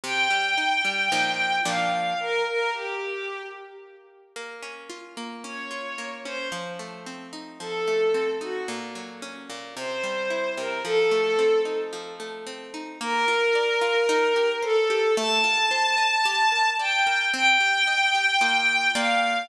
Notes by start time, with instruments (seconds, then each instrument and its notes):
0.03 orchestral harp C3, violin G5
0.30 orchestral harp G3
0.57 orchestral harp D#4
0.85 orchestral harp G3
1.12 orchestral harp A#2 F3 D#4
1.65 orchestral harp A#2 F3 D4, violin F5
2.20 violin A#4
2.47 violin A#4
2.74 violin G4
4.36 orchestral harp A#3
4.63 orchestral harp C#4
4.90 orchestral harp F4
5.17 orchestral harp A#3
5.44 orchestral harp C#4, violin C#5
5.71 orchestral harp F4
5.98 orchestral harp A#3
6.25 orchestral harp C#4, violin C5
6.52 orchestral harp F3
6.79 orchestral harp A3
7.06 orchestral harp C4
7.33 orchestral harp D#4
7.60 orchestral harp F3, violin A4
7.88 orchestral harp A3
8.14 orchestral harp C4
8.41 orchestral harp D#4, violin F#4
8.68 orchestral harp A#2
8.95 orchestral harp F#3
9.22 orchestral harp C#4
9.50 orchestral harp A#2
9.77 orchestral harp C3, violin C5
10.03 orchestral harp G3
10.30 orchestral harp E4
10.57 orchestral harp C3, violin A#4
10.85 orchestral harp F3, violin A4
11.11 orchestral harp A3
11.39 orchestral harp C4
11.65 orchestral harp D#4
11.93 orchestral harp F3
12.20 orchestral harp A3
12.47 orchestral harp C4
12.74 orchestral harp D#4
13.01 orchestral harp A#3, violin A#4
13.28 orchestral harp F4
13.55 orchestral harp D5
13.81 orchestral harp F4
14.09 orchestral harp D#4
14.36 orchestral harp G4
14.63 violin A4, orchestral harp C5
14.90 orchestral harp G4
15.17 orchestral harp A3, violin A5
15.44 orchestral harp F4
15.71 orchestral harp C5
15.98 orchestral harp D#5
16.25 orchestral harp G4
16.52 orchestral harp A#4
16.79 orchestral harp D5, violin G5
17.07 orchestral harp A#4
17.33 orchestral harp C4, violin G5
17.60 orchestral harp G4
17.87 orchestral harp D#5
18.15 orchestral harp G4
18.41 orchestral harp A#3 F4 D#5
18.95 orchestral harp A#3 F4 D5, violin F5